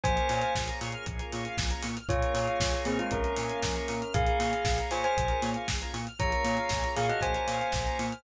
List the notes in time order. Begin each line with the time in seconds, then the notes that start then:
0.04 A#1 A#3 C#4 F4 G#4 C5 G#5, kick, closed hi-hat
0.17 A#4, closed hi-hat
0.29 A#2 C#5, open hi-hat
0.42 F5, closed hi-hat
0.55 A#1 G#5, kick, snare
0.68 A#5, closed hi-hat
0.81 A#2 C#6, open hi-hat
0.92 F6, closed hi-hat
1.06 A#1 G#4, kick, closed hi-hat
1.19 A#4, closed hi-hat
1.32 A#2 C#5, open hi-hat
1.45 F5, closed hi-hat
1.57 A#1 G#5, kick, snare
1.70 A#5, closed hi-hat
1.82 A#2 C#6, open hi-hat
1.96 F6, closed hi-hat
2.09 A#1 A#3 C#4 F4 G#4 C#5, kick, closed hi-hat
2.22 A#4, closed hi-hat
2.34 A#2 C#5, open hi-hat
2.47 F5, closed hi-hat
2.60 A#1 G#5, kick, snare
2.73 A#5, closed hi-hat
2.85 A#2 C4 G#4 C#6, open hi-hat
2.99 G#3 F4 F6, closed hi-hat
3.11 A#1 C#4 G#4 A#4, kick, closed hi-hat
3.24 A#4, closed hi-hat
3.37 A#2 C#5, open hi-hat
3.49 F5, closed hi-hat
3.62 A#1 G#5, kick, snare
3.76 A#5, closed hi-hat
3.88 A#2 C#6, open hi-hat
4.01 F6, closed hi-hat
4.14 A#1 A#3 C#4 F4 G#4 F5, kick, closed hi-hat
4.26 A#4, closed hi-hat
4.39 A#2 C#5, open hi-hat
4.52 F5, closed hi-hat
4.65 A#1 G#5, kick, snare
4.78 A#5, closed hi-hat
4.91 A#2 C5 G#5 C#6, open hi-hat
5.04 C5 G#5 F6, closed hi-hat
5.17 A#1 G#4, kick, closed hi-hat
5.28 A#4, closed hi-hat
5.42 A#2 C#5, open hi-hat
5.54 F5, closed hi-hat
5.68 A#1 G#5, kick, snare
5.81 A#5, closed hi-hat
5.93 A#2 C#6, open hi-hat
6.07 F6, closed hi-hat
6.19 A#1 A#3 C#4 F4 G#4 C#5 A#5, kick, closed hi-hat
6.32 A#4, closed hi-hat
6.44 A#2 C#5, open hi-hat
6.57 F5, closed hi-hat
6.69 A#1 G#5, kick, snare
6.83 A#5, closed hi-hat
6.96 A#2 G#4 F5 C#6, open hi-hat
7.09 F#4 D#5 F6, closed hi-hat
7.21 A#1 G#4 C5 G#5, kick, closed hi-hat
7.35 A#4, closed hi-hat
7.47 A#2 C#5, open hi-hat
7.61 F5, closed hi-hat
7.72 A#1 G#5, kick, snare
7.86 A#5, closed hi-hat
7.99 A#2 C#6, open hi-hat
8.11 F6, closed hi-hat